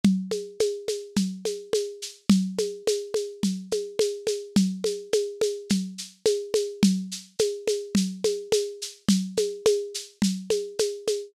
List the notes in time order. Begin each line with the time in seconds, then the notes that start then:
0.04 low conga, shaker
0.31 high conga, shaker
0.60 high conga, shaker
0.88 high conga, shaker
1.16 low conga, shaker
1.45 high conga, shaker
1.73 high conga, shaker
2.02 shaker
2.30 low conga, shaker
2.58 high conga, shaker
2.87 high conga, shaker
3.14 high conga, shaker
3.43 low conga, shaker
3.71 high conga, shaker
3.99 high conga, shaker
4.27 high conga, shaker
4.56 low conga, shaker
4.84 high conga, shaker
5.13 high conga, shaker
5.41 high conga, shaker
5.70 low conga, shaker
5.98 shaker
6.26 high conga, shaker
6.54 high conga, shaker
6.83 low conga, shaker
7.12 shaker
7.39 high conga, shaker
7.68 high conga, shaker
7.95 low conga, shaker
8.24 high conga, shaker
8.52 high conga, shaker
8.82 shaker
9.09 low conga, shaker
9.37 high conga, shaker
9.66 high conga, shaker
9.94 shaker
10.22 low conga, shaker
10.50 high conga, shaker
10.79 high conga, shaker
11.07 high conga, shaker